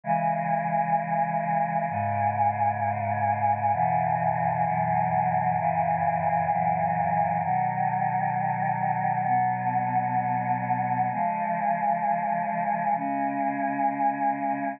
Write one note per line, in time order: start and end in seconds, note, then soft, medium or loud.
0.04 1.86 C#3 loud
0.04 1.86 E3 medium
0.04 1.86 G#3 medium
1.89 3.71 G#2 medium
1.89 3.71 C#3 loud
1.89 3.71 G#3 medium
3.73 4.64 F#2 medium
3.73 4.64 B2 medium
3.73 4.64 C#3 medium
3.73 4.64 E3 medium
4.65 5.56 F#2 medium
4.65 5.56 B2 medium
4.65 5.56 E3 medium
4.65 5.56 F#3 medium
5.58 6.49 F#2 loud
5.58 6.49 A#2 medium
5.58 6.49 C#3 loud
5.58 6.49 E3 medium
6.50 7.41 F#2 medium
6.50 7.41 A#2 loud
6.50 7.41 E3 medium
6.50 7.41 F#3 medium
7.42 9.25 B2 medium
7.42 9.25 D#3 loud
7.42 9.25 F#3 medium
9.26 11.09 B2 medium
9.26 11.09 F#3 loud
9.26 11.09 B3 medium
11.11 12.94 C#3 medium
11.11 12.94 F3 medium
11.11 12.94 G#3 medium
12.95 14.78 C#3 medium
12.95 14.78 G#3 medium
12.95 14.78 C#4 medium